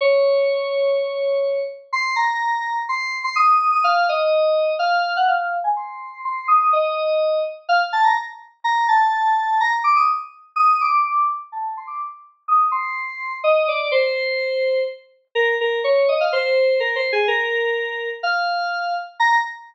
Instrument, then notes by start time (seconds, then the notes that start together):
electric piano 2
0.01 C#5
1.93 C6
2.16 A#5
2.89 C6
3.24 C6
3.36 D#6
3.71 D#6
3.84 F5
4.09 D#5
4.79 F5
5.17 F#5
5.28 F5
5.64 G#5
5.76 C6
6.25 C6
6.48 D#6
6.73 D#5
7.69 F5
7.93 A5
8.04 A#5
8.64 A#5
8.88 A5
9.60 A#5
9.84 D6
9.96 D#6
10.56 D#6
10.81 D6
11.52 A5
11.77 C6
11.87 D6
12.48 D#6
12.71 C6
13.44 D#5
13.68 D5
13.92 C5
15.35 A#4
15.61 A#4
15.84 C#5
16.09 D#5
16.20 F5
16.32 C5
16.80 A#4
16.96 C5
17.12 G#4
17.28 A#4
18.23 F5
19.20 A#5